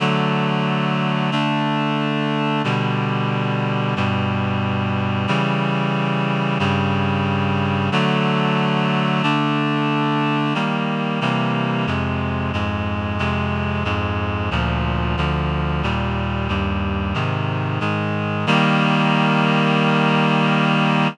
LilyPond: \new Staff { \time 4/4 \key d \major \tempo 4 = 91 <d fis a>2 <d a d'>2 | <b, d g>2 <g, b, g>2 | <cis e g>2 <g, cis g>2 | <d fis a>2 <d a d'>2 |
\key ees \major <ees g bes>4 <c e g bes>4 <f, c aes>4 <f, aes, aes>4 | <f, c aes>4 <f, aes, aes>4 <d, bes, f>4 <d, d f>4 | <ees, bes, g>4 <ees, g, g>4 <aes, c ees>4 <aes, ees aes>4 | <ees g bes>1 | }